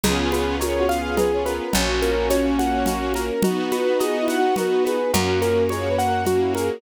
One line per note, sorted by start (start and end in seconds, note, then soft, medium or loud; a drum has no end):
0.04 1.60 C#2 medium
0.04 0.55 B3 loud
0.04 1.73 B3 loud
0.04 0.55 C#4 loud
0.04 1.73 C#4 loud
0.04 0.55 F4 loud
0.04 1.73 F4 loud
0.04 0.55 G#4 medium
0.04 0.30 G#4 medium
0.04 0.55 G#4 medium
0.04 1.73 G#4 medium
0.04 cowbell medium
0.04 low conga medium
0.04 shaker medium
0.32 0.58 B4 medium
0.32 high conga medium
0.32 shaker medium
0.60 1.62 B3 medium
0.60 1.62 C#4 medium
0.60 1.62 F4 medium
0.60 1.62 G#4 medium
0.60 0.78 A#4 medium
0.60 0.87 C#5 medium
0.60 cowbell medium
0.60 high conga medium
0.60 shaker medium
0.79 0.96 F#4 medium
0.89 1.15 F5 medium
0.89 high conga medium
0.89 shaker medium
0.99 1.17 G#4 medium
1.17 1.43 G#4 medium
1.17 1.31 B4 medium
1.17 cowbell medium
1.17 low conga medium
1.17 shaker medium
1.33 1.46 C#5 medium
1.46 1.72 A#4 medium
1.46 1.72 B4 medium
1.46 high conga medium
1.46 shaker medium
1.73 3.31 A#1 medium
1.73 3.27 A#3 medium
1.73 3.43 A#3 medium
1.73 2.89 C#4 medium
1.73 3.27 C#4 loud
1.73 3.43 C#4 loud
1.73 2.00 F#4 medium
1.73 3.27 F#4 loud
1.73 3.43 F#4 medium
1.73 cowbell medium
1.73 low conga medium
1.73 shaker medium
2.02 2.28 A#4 medium
2.02 high conga medium
2.02 shaker medium
2.30 2.56 C#5 medium
2.30 cowbell medium
2.30 high conga medium
2.30 shaker medium
2.59 2.85 F#5 medium
2.59 high conga medium
2.59 shaker medium
2.86 3.13 F#4 medium
2.86 cowbell medium
2.86 low conga medium
2.86 shaker medium
3.14 3.42 A#4 medium
3.14 high conga medium
3.14 shaker medium
3.43 5.12 B3 medium
3.43 4.97 B3 loud
3.43 5.12 D#4 medium
3.43 4.97 D#4 medium
3.43 3.93 F#4 medium
3.43 5.12 F#4 loud
3.43 3.70 F#4 medium
3.43 4.97 F#4 loud
3.43 cowbell medium
3.43 low conga loud
3.43 shaker medium
3.72 3.98 B4 medium
3.72 high conga medium
3.72 shaker medium
4.00 4.18 G#4 medium
4.00 4.26 D#5 medium
4.00 cowbell medium
4.00 high conga medium
4.00 shaker medium
4.21 4.39 E4 medium
4.28 4.55 F#5 medium
4.28 high conga medium
4.28 shaker medium
4.37 4.55 F#4 medium
4.56 4.83 F#4 medium
4.56 4.70 A#4 medium
4.56 cowbell medium
4.56 low conga medium
4.56 shaker medium
4.72 4.85 B4 medium
4.85 5.12 G#4 medium
4.85 5.11 B4 medium
4.85 high conga medium
4.85 shaker medium
5.13 6.70 F#2 medium
5.13 5.65 A#3 medium
5.13 6.81 A#3 medium
5.13 5.65 C#4 loud
5.13 6.81 C#4 medium
5.13 5.40 F#4 medium
5.13 5.65 F#4 medium
5.13 6.81 F#4 loud
5.13 5.63 A#4 medium
5.13 cowbell medium
5.13 low conga medium
5.13 shaker medium
5.42 5.68 A#4 medium
5.42 high conga medium
5.42 shaker medium
5.69 6.21 A#3 medium
5.69 6.21 C#4 medium
5.69 6.21 F#4 medium
5.69 5.88 G#4 medium
5.69 5.96 C#5 medium
5.69 cowbell medium
5.69 high conga medium
5.69 shaker medium
5.89 6.07 B4 medium
5.98 6.25 F#5 medium
5.98 shaker medium
6.07 6.25 A#4 medium
6.25 6.78 A#3 medium
6.25 6.78 C#4 medium
6.25 6.39 F#4 medium
6.25 6.78 F#4 medium
6.25 6.53 F#4 medium
6.25 cowbell medium
6.25 low conga medium
6.25 shaker medium
6.41 6.55 E4 medium
6.55 6.81 G#4 medium
6.55 6.81 A#4 medium
6.55 high conga medium
6.55 shaker medium